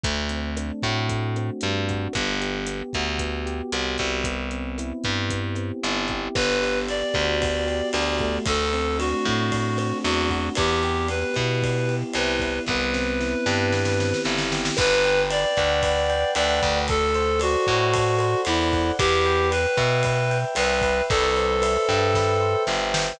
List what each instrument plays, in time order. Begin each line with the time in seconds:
0.04 electric bass (finger) D2, electric piano 1 A3, kick, closed hi-hat
0.29 electric piano 1 C4, closed hi-hat
0.57 electric piano 1 D4, cross-stick, closed hi-hat
0.82 electric bass (finger) A2, electric piano 1 F#4, kick, closed hi-hat
1.09 electric piano 1 A3, kick, closed hi-hat
1.36 electric piano 1 C4, cross-stick, closed hi-hat
1.61 electric bass (finger) G2, electric piano 1 D4, closed hi-hat
1.88 electric piano 1 F#4, kick, closed hi-hat
2.13 electric bass (finger) G1, electric piano 1 B3, kick, cross-stick, closed hi-hat
2.41 electric piano 1 G4, closed hi-hat
2.67 electric piano 1 B3, closed hi-hat
2.93 electric bass (finger) D2, electric piano 1 F#4, kick, cross-stick, closed hi-hat
3.19 electric piano 1 B3, kick, closed hi-hat
3.46 electric piano 1 G4, closed hi-hat
3.72 electric bass (finger) C2, electric piano 1 F#4, cross-stick, closed hi-hat
3.98 electric bass (finger) C2, electric piano 1 B3, kick, closed hi-hat
4.24 electric piano 1 B3, kick, closed hi-hat
4.51 electric piano 1 C4, closed hi-hat
4.78 electric piano 1 E4, cross-stick, closed hi-hat
5.04 electric bass (finger) G2, electric piano 1 G4, kick, closed hi-hat
5.30 electric piano 1 B3, kick, closed hi-hat
5.55 electric piano 1 C4, cross-stick, closed hi-hat
5.83 electric bass (finger) G1, electric piano 1 E4, closed hi-hat
6.08 electric piano 1 G4, kick, closed hi-hat
6.35 electric bass (finger) G1, electric piano 1 B3, clarinet B4, kick, cross-stick, crash
6.62 electric piano 1 G4, ride
6.88 electric piano 1 B3, clarinet D5, ride
7.14 electric bass (finger) D2, electric piano 1 F#4, kick, cross-stick, ride
7.41 electric piano 1 B3, kick, ride
7.67 electric piano 1 G4, ride
7.93 electric bass (finger) D2, electric piano 1 F#4, clarinet D5, cross-stick, ride
8.18 electric piano 1 A3, kick, ride
8.46 electric bass (finger) D2, clarinet A4, kick, ride
8.73 electric piano 1 C4, ride
8.98 electric piano 1 D4, clarinet F#4, cross-stick, ride
9.25 electric bass (finger) A2, electric piano 1 F#4, kick, ride
9.51 electric piano 1 A3, kick, ride
9.77 electric piano 1 C4, cross-stick, ride
10.04 electric bass (finger) E2, electric piano 1 D4, clarinet F#4, ride
10.29 electric piano 1 F#4, kick, ride
10.55 electric bass (finger) E2, electric piano 1 B3, clarinet G4, kick, cross-stick, ride
10.83 electric piano 1 G4, ride
11.08 electric piano 1 B3, clarinet B4, ride
11.34 electric bass (finger) B2, electric piano 1 E4, kick, cross-stick, ride
11.62 electric piano 1 B3, kick, ride
11.88 electric piano 1 G4, ride
12.13 electric bass (finger) C2, electric piano 1 E4, clarinet B4, cross-stick, ride
12.39 electric piano 1 B3, kick, ride
12.67 electric bass (finger) C2, electric piano 1 B3, clarinet B4, kick, snare
12.94 electric piano 1 C4, snare
13.20 electric piano 1 E4, snare
13.46 electric bass (finger) G2, electric piano 1 G4, snare
13.72 electric piano 1 B3, snare
13.85 snare
14.00 electric piano 1 C4, snare
14.14 snare
14.25 electric bass (finger) G1, electric piano 1 E4, snare
14.38 snare
14.52 electric piano 1 G4, snare
14.65 snare
14.77 electric bass (finger) G1, electric piano 1 B4, clarinet B4, kick, cross-stick, crash
15.04 electric piano 1 G5, ride
15.30 electric piano 1 B4, clarinet D5, ride
15.57 electric bass (finger) D2, electric piano 1 F#5, kick, cross-stick, ride
15.83 electric piano 1 B4, kick, ride
16.10 electric piano 1 G5, ride
16.35 electric bass (finger) D2, clarinet D5, electric piano 1 F#5, cross-stick, ride
16.63 electric bass (finger) D2, electric piano 1 B4, kick, ride
16.88 electric piano 1 A4, clarinet A4, kick, ride
17.14 electric piano 1 C5, ride
17.40 clarinet F#4, electric piano 1 D5, cross-stick, ride
17.67 electric bass (finger) A2, electric piano 1 F#5, kick, ride
17.93 electric piano 1 A4, kick, ride
18.19 electric piano 1 C5, cross-stick, ride
18.45 electric bass (finger) E2, clarinet E4, electric piano 1 D5, ride
18.73 electric piano 1 F#5, kick, ride
18.99 electric bass (finger) E2, clarinet G4, electric piano 1 B4, kick, cross-stick, ride
19.26 electric piano 1 G5, ride
19.51 electric piano 1 B4, clarinet B4, ride
19.77 electric bass (finger) B2, electric piano 1 E5, kick, cross-stick, ride
20.03 electric piano 1 B4, kick, ride
20.30 electric piano 1 G5, ride
20.55 electric bass (finger) C2, clarinet B4, electric piano 1 E5, cross-stick, ride
20.81 electric piano 1 B4, kick, ride
21.10 electric bass (finger) C2, clarinet A4, kick, ride
21.36 electric piano 1 C5, ride
21.62 electric piano 1 E5, cross-stick, ride
21.88 electric bass (finger) G2, electric piano 1 G5, kick, ride
22.14 electric piano 1 B4, kick, snare
22.41 electric piano 1 C5
22.67 electric bass (finger) G1, electric piano 1 E5, snare
22.94 electric piano 1 G5, snare